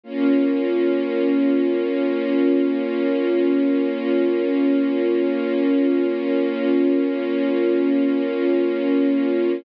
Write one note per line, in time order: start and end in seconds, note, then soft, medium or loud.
0.04 9.54 A#3 medium
0.04 9.54 C#4 medium
0.04 9.54 F4 medium